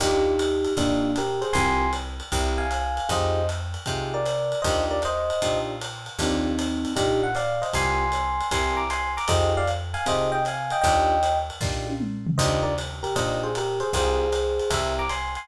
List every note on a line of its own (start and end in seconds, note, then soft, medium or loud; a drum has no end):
0.00 0.67 D#2 medium
0.00 0.32 D4 medium
0.00 0.73 D#4 medium
0.00 0.32 D#4 loud
0.00 0.32 F4 loud
0.00 0.73 G4 medium
0.00 0.32 G4 loud
0.00 kick soft
0.00 crash medium
0.00 ride medium
0.39 hi-hat pedal medium
0.39 ride medium
0.65 ride medium
0.77 1.44 A#2 medium
0.77 1.15 A#3 medium
0.77 1.09 D4 loud
0.77 1.15 D4 medium
0.77 1.09 D#4 loud
0.77 1.09 F4 loud
0.77 1.09 G4 medium
0.77 kick medium
0.77 ride medium
1.16 1.40 G4 medium
1.16 1.40 A#4 medium
1.16 hi-hat pedal medium
1.16 ride medium
1.41 1.53 G#4 medium
1.41 1.53 C5 medium
1.41 ride medium
1.53 2.22 C2 medium
1.53 1.86 C4 loud
1.53 1.86 F4 medium
1.53 1.86 G4 loud
1.53 1.86 A#4 loud
1.53 1.90 G#5 medium
1.53 1.90 C6 loud
1.53 kick medium
1.53 ride medium
1.93 hi-hat pedal medium
1.93 ride medium
2.20 ride medium
2.32 3.00 C2 medium
2.32 2.63 C4 loud
2.32 2.63 E4 loud
2.32 2.63 G4 loud
2.32 2.63 A#4 medium
2.32 kick medium
2.32 ride medium
2.58 3.06 F5 medium
2.58 3.06 G#5 medium
2.71 hi-hat pedal medium
2.71 ride medium
2.97 ride medium
3.09 3.77 F2 medium
3.09 3.40 D#4 loud
3.09 3.40 F4 loud
3.09 3.40 G4 loud
3.09 3.40 G#4 loud
3.09 3.46 C5 medium
3.09 3.46 D#5 medium
3.09 kick medium
3.09 ride medium
3.49 hi-hat pedal medium
3.49 ride medium
3.74 ride medium
3.86 4.55 C3 medium
3.86 4.18 D#4 medium
3.86 4.18 F4 medium
3.86 4.18 G4 medium
3.86 4.18 G#4 medium
3.86 kick medium
3.86 ride medium
4.14 4.59 A#4 medium
4.14 4.59 D5 medium
4.25 hi-hat pedal medium
4.25 ride medium
4.52 ride medium
4.62 5.32 D#2 medium
4.62 4.96 D4 loud
4.62 4.96 D#4 loud
4.62 4.96 F4 loud
4.62 4.96 G4 loud
4.62 4.84 C5 medium
4.62 4.84 D#5 medium
4.62 kick medium
4.62 ride medium
4.91 5.01 A#4 medium
4.91 5.01 D5 medium
5.02 5.59 C5 medium
5.02 5.59 D#5 loud
5.02 hi-hat pedal medium
5.02 ride medium
5.30 ride medium
5.42 6.09 A#2 medium
5.42 5.73 D4 medium
5.42 5.73 D#4 medium
5.42 5.73 F4 medium
5.42 5.73 G4 medium
5.42 kick soft
5.42 ride medium
5.81 hi-hat pedal medium
5.81 ride medium
6.06 ride medium
6.19 6.86 D#2 medium
6.19 6.93 C4 medium
6.19 6.50 D4 loud
6.19 6.50 D#4 loud
6.19 6.93 D#4 medium
6.19 6.50 F4 loud
6.19 6.50 G4 loud
6.19 kick soft
6.19 ride medium
6.59 hi-hat pedal medium
6.59 ride medium
6.85 ride medium
6.96 7.64 A#2 medium
6.96 7.27 D4 medium
6.96 7.21 D#4 medium
6.96 7.27 D#4 medium
6.96 7.27 F4 medium
6.96 7.21 G4 medium
6.96 7.27 G4 medium
6.96 kick medium
6.96 ride medium
7.23 7.35 F#5 medium
7.35 7.60 D5 medium
7.35 7.60 F5 medium
7.35 hi-hat pedal medium
7.35 ride medium
7.62 7.72 C5 medium
7.62 7.72 D#5 medium
7.62 ride medium
7.73 8.42 C2 medium
7.73 8.05 C4 loud
7.73 8.05 F4 loud
7.73 8.05 G4 medium
7.73 8.05 A#4 loud
7.73 8.46 G#5 medium
7.73 8.46 C6 loud
7.73 kick medium
7.73 ride medium
8.12 hi-hat pedal medium
8.12 ride medium
8.40 ride medium
8.51 9.19 C2 medium
8.51 8.83 C4 loud
8.51 8.83 E4 loud
8.51 8.83 G4 loud
8.51 8.83 A#4 loud
8.51 8.78 G#5 medium
8.51 8.78 C6 medium
8.51 kick medium
8.51 ride medium
8.77 8.88 A#5 medium
8.77 8.88 D6 medium
8.90 9.12 G#5 medium
8.90 9.12 C6 medium
8.90 hi-hat pedal medium
8.90 ride medium
9.17 9.29 A#5 medium
9.17 9.29 D6 medium
9.17 ride medium
9.28 9.96 F2 medium
9.28 9.60 D#4 loud
9.28 9.60 F4 loud
9.28 9.60 G4 loud
9.28 9.60 G#4 loud
9.28 9.52 C5 medium
9.28 9.52 D#5 medium
9.28 kick medium
9.28 ride loud
9.57 9.68 D5 medium
9.57 9.68 F5 medium
9.67 hi-hat pedal medium
9.67 ride medium
9.94 10.05 F5 medium
9.94 10.05 G#5 medium
9.94 ride medium
10.06 10.73 C3 medium
10.06 10.38 D#4 medium
10.06 10.38 F4 medium
10.06 10.38 G4 medium
10.06 10.38 G#4 medium
10.06 10.30 C5 medium
10.06 10.30 D#5 medium
10.06 kick soft
10.06 ride medium
10.32 10.43 D#5 medium
10.32 10.43 G5 medium
10.45 10.72 F5 medium
10.45 10.72 G#5 medium
10.45 hi-hat pedal medium
10.45 ride medium
10.70 10.81 D#5 medium
10.70 10.81 G5 medium
10.70 ride medium
10.81 11.51 D#2 medium
10.81 11.15 D4 loud
10.81 11.15 D#4 loud
10.81 11.15 F4 loud
10.81 11.15 G4 loud
10.81 11.38 D#5 medium
10.81 11.38 G5 medium
10.81 kick medium
10.81 ride medium
11.23 hi-hat pedal medium
11.23 ride medium
11.50 ride medium
11.61 12.28 A#2 medium
11.61 11.93 D4 medium
11.61 11.93 D#4 medium
11.61 11.93 F4 medium
11.61 11.93 G4 medium
11.61 kick medium
11.61 snare medium
11.86 high tom medium
12.00 mid tom medium
12.27 floor tom loud
12.38 13.06 D#2 medium
12.38 12.70 D4 loud
12.38 12.70 D#4 loud
12.38 12.70 F4 loud
12.38 12.70 G4 medium
12.38 12.61 C5 medium
12.38 12.61 D#5 medium
12.38 kick medium
12.38 crash medium
12.38 ride medium
12.63 12.74 A#4 medium
12.63 12.74 D5 medium
12.78 hi-hat pedal medium
12.78 ride medium
13.03 13.15 G4 medium
13.03 13.15 A#4 medium
13.03 ride medium
13.15 13.83 A#2 medium
13.15 13.47 D4 medium
13.15 13.47 D#4 medium
13.15 13.47 F4 medium
13.15 13.47 G4 medium
13.15 13.41 C5 medium
13.15 13.41 D#5 medium
13.15 kick soft
13.15 ride medium
13.43 13.53 G#4 medium
13.43 13.53 C5 medium
13.55 13.79 G4 medium
13.55 13.79 A#4 medium
13.55 hi-hat pedal medium
13.55 ride medium
13.80 13.91 G#4 medium
13.80 13.91 C5 medium
13.80 ride medium
13.93 14.61 C2 medium
13.93 14.25 C4 loud
13.93 14.25 F4 loud
13.93 14.25 G4 loud
13.93 14.71 G#4 medium
13.93 14.25 A#4 loud
13.93 14.70 C5 loud
13.93 kick medium
13.93 ride medium
14.32 hi-hat pedal medium
14.32 ride medium
14.59 ride medium
14.70 15.38 C2 medium
14.70 15.03 C4 loud
14.70 15.03 E4 medium
14.70 15.03 G4 loud
14.70 15.03 A#4 loud
14.70 14.92 C5 medium
14.70 14.92 E5 medium
14.70 kick medium
14.70 ride loud
14.99 15.09 A#5 medium
14.99 15.09 D6 medium
15.09 15.31 G#5 medium
15.09 15.31 C6 medium
15.09 hi-hat pedal medium
15.09 ride medium
15.35 15.48 G#5 medium
15.35 15.48 C6 medium
15.35 ride medium